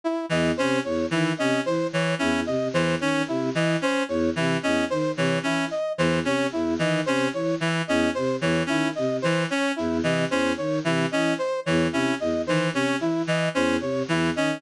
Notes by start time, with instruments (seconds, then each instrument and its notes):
0.04 brass section E4
0.29 choir aahs E2, clarinet E3, brass section D#5
0.57 choir aahs C3, clarinet C#4, brass section C5
0.84 choir aahs E2, brass section C#5
1.11 choir aahs D#3, clarinet E3, brass section E4
1.38 choir aahs C3, clarinet C#4, brass section D#5
1.65 choir aahs E3, brass section C5
1.93 clarinet E3, brass section C#5
2.19 choir aahs E2, clarinet C#4, brass section E4
2.46 choir aahs C3, brass section D#5
2.73 choir aahs E2, clarinet E3, brass section C5
3.00 choir aahs D#3, clarinet C#4, brass section C#5
3.28 choir aahs C3, brass section E4
3.55 choir aahs E3, clarinet E3, brass section D#5
3.82 clarinet C#4, brass section C5
4.08 choir aahs E2, brass section C#5
4.36 choir aahs C3, clarinet E3, brass section E4
4.63 choir aahs E2, clarinet C#4, brass section D#5
4.90 choir aahs D#3, brass section C5
5.17 choir aahs C3, clarinet E3, brass section C#5
5.43 choir aahs E3, clarinet C#4, brass section E4
5.71 brass section D#5
5.98 choir aahs E2, clarinet E3, brass section C5
6.24 choir aahs C3, clarinet C#4, brass section C#5
6.52 choir aahs E2, brass section E4
6.79 choir aahs D#3, clarinet E3, brass section D#5
7.06 choir aahs C3, clarinet C#4, brass section C5
7.33 choir aahs E3, brass section C#5
7.60 clarinet E3, brass section E4
7.88 choir aahs E2, clarinet C#4, brass section D#5
8.15 choir aahs C3, brass section C5
8.41 choir aahs E2, clarinet E3, brass section C#5
8.66 choir aahs D#3, clarinet C#4, brass section E4
8.95 choir aahs C3, brass section D#5
9.22 choir aahs E3, clarinet E3, brass section C5
9.50 clarinet C#4, brass section C#5
9.76 choir aahs E2, brass section E4
10.03 choir aahs C3, clarinet E3, brass section D#5
10.31 choir aahs E2, clarinet C#4, brass section C5
10.57 choir aahs D#3, brass section C#5
10.84 choir aahs C3, clarinet E3, brass section E4
11.11 choir aahs E3, clarinet C#4, brass section D#5
11.39 brass section C5
11.66 choir aahs E2, clarinet E3, brass section C#5
11.92 choir aahs C3, clarinet C#4, brass section E4
12.20 choir aahs E2, brass section D#5
12.45 choir aahs D#3, clarinet E3, brass section C5
12.73 choir aahs C3, clarinet C#4, brass section C#5
13.00 choir aahs E3, brass section E4
13.27 clarinet E3, brass section D#5
13.55 choir aahs E2, clarinet C#4, brass section C5
13.80 choir aahs C3, brass section C#5
14.08 choir aahs E2, clarinet E3, brass section E4
14.36 choir aahs D#3, clarinet C#4, brass section D#5